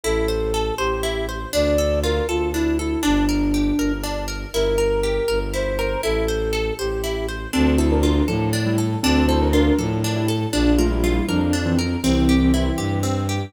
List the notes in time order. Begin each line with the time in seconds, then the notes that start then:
0.04 A1 E4 A4
0.28 C5
0.54 A4
0.78 A1 G4 C5
1.03 E4
1.29 C5
1.53 D2 D4 D5
1.78 A4
2.03 F4 A#4
2.28 D2 F4 A4
2.53 D4 E4
2.78 E4 A4
3.03 G1 D4
3.29 A#4
3.54 G4
3.78 G1 A#4
4.04 D4
4.28 A#4
4.52 G1 E4 A#4
4.78 A#4
5.03 G4
5.28 G1 A#4
5.54 E4 C5
5.79 A#4
6.03 A1 E4 A4
6.28 C5
6.53 A4
6.79 A1 G4 C5
7.04 E4
7.29 C5
7.53 D2 C4 D4 A4
7.78 E4 A4 C5
7.91 D4 A#4
8.03 D4 F4 A#4
8.28 A2 F3 D4 A4
8.53 D4
8.66 G3 E4
8.78 A4
9.03 D2 C4 D4 A4
9.28 E4 A4 C5
9.41 D4 A#4
9.53 D4 F4 A#4
9.78 A2 F3 D4 A4
10.04 D4
10.16 G3 E4
10.28 A4
10.53 A#1 F3 D4
10.78 A3 F4 A#4
10.91 G3 E4
11.03 G3 E4 F4
11.28 F2 F3 D4 A#4
11.53 D4
11.66 E3 C4
11.79 A#4
12.03 C2 E3 C4
12.29 G4
12.54 E3 C4 E4
12.78 G2 G4
13.03 C4
13.29 G4